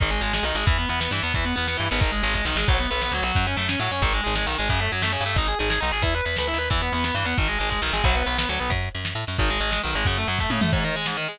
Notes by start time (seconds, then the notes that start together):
0.00 G#1 D#3, kick, closed hi-hat
0.11 G#3, closed hi-hat
0.21 G#1 G#3, closed hi-hat
0.33 G#3, snare
0.43 B1 D#3, closed hi-hat
0.55 G#1 G#3, closed hi-hat
0.66 E2 E3, kick, closed hi-hat
0.78 B3, closed hi-hat
0.89 E2 B3, closed hi-hat
1.00 B3, snare
1.11 G2 E3, closed hi-hat
1.23 E2 B3, closed hi-hat
1.34 E2 E3, kick, closed hi-hat
1.45 B3, closed hi-hat
1.56 E2 B3, closed hi-hat
1.67 B3, snare
1.77 G2 E3, closed hi-hat
1.90 G#1 B3, open hi-hat
2.01 D#3, kick, closed hi-hat
2.12 G#3, closed hi-hat
2.23 G#1 G#3, closed hi-hat
2.34 G#3, kick, snare
2.45 B1 D#3, snare
2.56 G#1 G#3, snare
2.68 B1 F#3, kick, crash
2.79 B3, closed hi-hat
2.91 B1 B3, closed hi-hat
3.02 B3, snare
3.11 D2 F#3, closed hi-hat
3.22 B1 F#3, open hi-hat
3.35 F#2, kick, closed hi-hat
3.46 C#4, closed hi-hat
3.57 F#2 A3, closed hi-hat
3.69 C#4, snare
3.79 A2 F#3, closed hi-hat
3.91 F#2 C#4, open hi-hat
4.02 G#1 D#3, kick, closed hi-hat
4.13 G#3, closed hi-hat
4.24 G#1 G#3, closed hi-hat
4.35 G#3, snare
4.46 B1 D#3, closed hi-hat
4.58 G#1 G#3, closed hi-hat
4.69 F#2 C#3, kick, closed hi-hat
4.80 A3, closed hi-hat
4.91 F#2 F#3, closed hi-hat
5.02 F#2 A3, snare
5.13 C#3, closed hi-hat
5.20 G2
5.25 A3, closed hi-hat
5.36 G#1 D#4, kick, closed hi-hat
5.48 G#4, closed hi-hat
5.59 G#1 G#4, closed hi-hat
5.70 G#4, snare
5.81 B1 D#4, closed hi-hat
5.92 G#1 G#4, closed hi-hat
6.02 E2 E4, kick, closed hi-hat
6.15 B4, closed hi-hat
6.25 E2 B4, closed hi-hat
6.36 D2 B4, snare
6.48 E4, closed hi-hat
6.54 D#2
6.58 B4, closed hi-hat
6.70 E2 E3, kick, closed hi-hat
6.81 B3, closed hi-hat
6.92 E2 B3, closed hi-hat
7.04 B3, snare
7.14 G2 E3, closed hi-hat
7.25 E2 B3, closed hi-hat
7.38 G#1 D#3, kick, closed hi-hat
7.48 G#3, closed hi-hat
7.59 G#1 G#3, closed hi-hat
7.70 G#3, kick, snare
7.82 B1 D#3, snare
7.93 G#1 G#3, snare
8.04 B1 F#3, kick, crash
8.16 B3, closed hi-hat
8.26 B1 B3, closed hi-hat
8.38 B3, snare
8.49 D2 F#3, closed hi-hat
8.60 B1 B3, open hi-hat
8.70 F#2, kick, closed hi-hat
8.83 closed hi-hat
8.95 F#2
9.05 snare, closed hi-hat
9.15 A2, closed hi-hat
9.27 F#2, open hi-hat
9.38 G#1 D#3, kick, closed hi-hat
9.49 G#3, closed hi-hat
9.60 G#1 G#3, closed hi-hat
9.71 G#3, snare
9.83 B1 D#3, closed hi-hat
9.94 G#1 G#3, closed hi-hat
10.05 F#2 C#3, kick, closed hi-hat
10.17 A3, closed hi-hat
10.28 F#2 F#3, closed hi-hat
10.39 A3, kick, snare
10.50 A2 C#3, high tom
10.61 F#2 A3, mid tom
10.73 G#2, kick, crash
10.78 closed hi-hat
10.84 D#3, closed hi-hat
10.90 closed hi-hat
10.95 G#3, closed hi-hat
11.01 closed hi-hat
11.06 G#2, snare
11.12 closed hi-hat
11.17 D#3, closed hi-hat
11.23 closed hi-hat
11.28 G#3, closed hi-hat
11.34 closed hi-hat